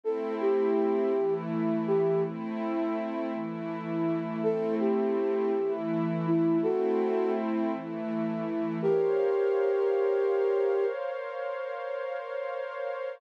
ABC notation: X:1
M:3/4
L:1/8
Q:1/4=82
K:Ador
V:1 name="Flute"
A G3 z G | z6 | A G3 z E | [FA]2 z4 |
[K:Bbdor] [GB]6 | z6 |]
V:2 name="Pad 5 (bowed)"
[A,CE]3 [E,A,E]3 | [A,CE]3 [E,A,E]3 | [A,CE]3 [E,A,E]3 | [A,CE]3 [E,A,E]3 |
[K:Bbdor] [Bcdf]6- | [Bcdf]6 |]